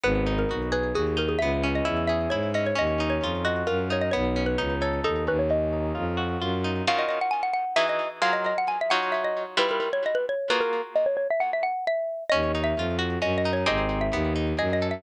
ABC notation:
X:1
M:3/4
L:1/16
Q:1/4=132
K:D#phr
V:1 name="Xylophone"
B3 A3 B2 G2 A G | e3 d3 e2 c2 d c | d3 c3 d2 A2 c d | c3 B3 c2 =A2 B c |
d8 z4 | ^e d d f g f f2 =e d2 z | ^e d d f g =e f2 e d2 z | B A A c d B c2 B A2 z |
d c c e f e f2 e4 | d3 e3 z2 (3d2 d2 c2 | d3 e3 z2 (3d2 d2 e2 |]
V:2 name="Acoustic Guitar (steel)"
B,2 D2 F2 G2 F2 D2 | B,2 C2 E2 G2 E2 C2 | C2 D2 ^E2 F2 E2 D2 | B,2 C2 D2 =A2 D2 C2 |
C2 D2 ^E2 F2 E2 D2 | [D,C^EF]8 [=E,DFG]4 | [F,^EGA]6 [F,DEc]6 | [=G,E=FB]8 [A,^E^F^G]4 |
z12 | C2 D2 ^E2 F2 C2 D2 | [^B,D=G^G]4 =B,2 D2 G2 =A2 |]
V:3 name="Violin" clef=bass
G,,,4 B,,,4 D,,4 | C,,4 E,,4 G,,4 | D,,4 ^E,,4 F,,4 | B,,,4 C,,4 D,,2 D,,2- |
D,,4 ^E,,4 F,,4 | z12 | z12 | z12 |
z12 | D,,4 ^E,,4 F,,4 | G,,,4 D,,4 F,,4 |]